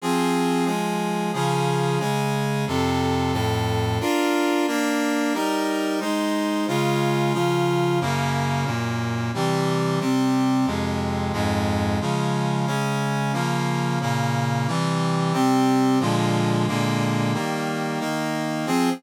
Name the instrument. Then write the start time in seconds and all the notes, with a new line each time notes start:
brass section
0.02 F3 C4 G#4
0.65 F3 G#3 G#4
1.33 C#3 F3 G#4
1.99 C#3 G#3 G#4
2.67 F2 C3 A4
3.33 F2 A2 A4
4.00 D4 F4 A#4
4.67 A#3 D4 A#4
5.33 G3 D#4 A#4
6.00 G#3 D#4 C5
6.68 C#3 G#3 F4
7.33 C#3 F3 F4
8.01 F#2 C#3 A#3
8.65 F#2 A#2 A#3
9.34 C3 E3 G3
10.00 C3 G3 C4
10.66 F2 C3 G#3
11.33 F2 G#2 G#3
12.01 C#3 F3 G#3
12.66 C#3 G#3 C#4
13.33 C#3 F3 A#3
14.01 A#2 C#3 A#3
14.67 C3 E3 G3
15.33 C3 G3 C4
16.00 A#2 D3 F3 G#3
16.67 A#2 D3 G#3 A#3
17.33 D#3 G3 A#3
18.00 D#3 A#3 D#4
18.66 F3 C4 G#4